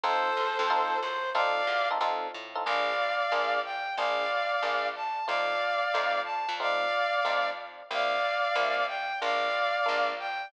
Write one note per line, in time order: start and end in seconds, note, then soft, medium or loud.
0.03 0.34 F2 medium
0.03 0.30 C4 loud
0.03 0.30 D#4 loud
0.03 0.30 F4 loud
0.03 0.30 A4 loud
0.03 0.99 A4 medium
0.03 0.99 C5 loud
0.37 0.58 E2 medium
0.59 1.00 F2 medium
0.70 0.96 C4 loud
0.70 0.96 D#4 loud
0.70 0.96 F4 loud
0.70 0.96 A4 loud
1.01 1.33 F#2 medium
1.01 1.30 C5 medium
1.35 1.65 F2 medium
1.35 1.61 C4 loud
1.35 1.61 D#4 loud
1.35 1.61 F4 loud
1.35 1.61 A4 medium
1.35 1.88 D5 loud
1.35 1.88 F5 loud
1.67 1.98 E2 medium
1.91 1.98 C4 medium
1.91 1.98 D#4 loud
1.91 1.98 F4 medium
1.91 1.98 A4 medium
2.01 2.31 F2 medium
2.01 2.27 C4 loud
2.01 2.27 D#4 loud
2.01 2.27 F4 loud
2.01 2.27 A4 loud
2.34 2.65 A2 medium
2.55 2.63 C4 medium
2.55 2.63 D#4 medium
2.55 2.63 F4 medium
2.55 2.63 A4 medium
2.65 3.23 A#1 medium
2.65 2.92 A#3 medium
2.65 2.92 D4 medium
2.65 2.92 F4 medium
2.65 2.92 G#4 medium
2.65 3.60 D5 medium
2.65 3.60 F5 loud
3.32 3.89 A#1 medium
3.32 3.58 A#3 medium
3.32 3.58 D4 medium
3.32 3.58 F4 medium
3.32 3.58 G#4 medium
3.64 3.96 G5 medium
3.97 4.55 A#1 medium
3.97 4.25 A#3 medium
3.97 4.25 D4 medium
3.97 4.25 F4 medium
3.97 4.25 G#4 medium
3.97 4.88 D5 medium
3.97 4.88 F5 loud
4.62 5.20 A#1 medium
4.62 4.89 A#3 medium
4.62 4.89 D4 medium
4.62 4.89 F4 medium
4.62 4.89 G#4 medium
4.96 5.26 A5 medium
5.27 5.86 F2 medium
5.27 5.54 A3 medium
5.27 5.54 C4 medium
5.27 5.54 D#4 medium
5.27 5.54 F4 medium
5.27 6.20 D5 medium
5.27 6.20 F5 loud
5.94 6.46 F2 medium
5.94 6.20 A3 medium
5.94 6.20 C4 medium
5.94 6.20 D#4 medium
5.94 6.20 F4 medium
6.25 6.53 A5 medium
6.49 7.16 F2 medium
6.60 6.86 A3 medium
6.60 6.86 C4 medium
6.60 6.86 D#4 medium
6.60 6.86 F4 medium
6.60 7.48 D5 loud
6.60 7.48 F5 loud
7.25 7.83 F2 medium
7.25 7.51 A3 medium
7.25 7.51 C4 medium
7.25 7.51 D#4 medium
7.25 7.51 F4 medium
7.91 8.48 C2 medium
7.91 8.17 G3 medium
7.91 8.17 A#3 medium
7.91 8.17 C4 medium
7.91 8.17 E4 medium
7.91 8.85 D5 medium
7.91 8.85 F5 loud
8.55 9.13 C2 medium
8.55 8.82 G3 medium
8.55 8.82 A#3 medium
8.55 8.82 C4 medium
8.55 8.82 E4 medium
8.87 9.19 G5 medium
9.22 9.79 A#1 medium
9.22 9.48 G#3 medium
9.22 9.48 A#3 medium
9.22 9.48 D4 medium
9.22 9.48 F4 medium
9.22 10.10 D5 medium
9.22 10.10 F5 loud
9.86 10.46 A#1 medium
9.86 10.12 G#3 medium
9.86 10.12 A#3 medium
9.86 10.12 D4 medium
9.86 10.12 F4 medium
10.19 10.48 G5 medium